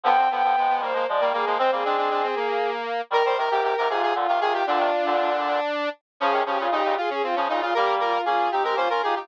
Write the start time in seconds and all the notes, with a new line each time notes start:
0.04 D3 F3 B3 G5
0.18 C4
0.31 D3 F3 B3 G5
0.43 D3 F3 B3
0.56 F3 G#3 B3
0.69 B3
0.81 D#3 G3 A#3 C5
0.93 F3 G#3 A#3
1.07 F3 G#3 D5
1.20 D#3 G3 A#3
1.33 G3 A#3 G#4
1.46 F3 G#3 A#3
1.58 G#3 C4 C5
1.71 G3 A#3 C4 G#4
1.85 G#3 C4 D4
1.97 D4
2.10 D4
2.23 C4
2.36 A#3
3.10 D#3 G3 A#4
3.25 D#3 G3 C5
3.37 C3 D#3 A#4
3.51 G#2 C3 G4
3.62 G#2 C3 G4
3.77 G#2 C3 A#4
3.89 G#2 C3 F4 G#4
4.02 G#4
4.15 A#2 D3 F4
4.28 C3 D#3 F4
4.40 C3 D#3 F4 G#4
4.53 G4
4.66 A#2 D3 D4 F4
4.79 C3 D#3
5.06 A#2 D3
6.20 C#3 F3 C#4 G#4
6.32 C3 D#3
6.46 C#3 F3 C#4 G4
6.59 A#2 C#3 F4
6.71 A#2 C#3 D#4 G4
6.85 A#2 C#3
6.97 F4 G#4
7.10 C#4 G#4
7.23 C4 F4
7.36 C#3 F3 C#4
7.49 A#2 C#3 D#4 F4
7.61 F4
7.74 G3 A#3 G4 A#4
8.00 F4 A#4
8.13 F4
8.25 A#3 C#4 F4 G#4
8.51 C4 D#4 G4
8.63 G#3 C4 G4 A#4
8.76 A#3 C#4 F4 C5
8.90 C#4 F4 A#4
9.02 D#4 F4 G4 G#4
9.15 D#4 F4 G4